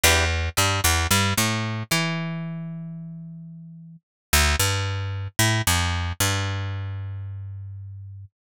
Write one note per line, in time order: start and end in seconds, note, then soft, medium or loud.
0.03 0.49 E2 medium
0.03 0.25 D4 medium
0.03 0.25 E4 medium
0.03 0.25 G4 medium
0.03 0.25 B4 medium
0.57 0.81 G2 medium
0.57 0.80 G3 medium
0.84 1.07 E2 medium
0.84 1.07 E3 medium
1.11 1.34 G2 medium
1.11 1.33 G3 medium
1.37 1.83 A2 medium
1.37 1.83 A3 medium
1.91 3.96 E3 medium
1.91 3.96 E4 medium
4.33 4.56 D2 medium
4.59 5.28 G2 medium
5.39 5.62 A2 medium
5.67 6.12 F2 medium
6.20 8.25 G2 medium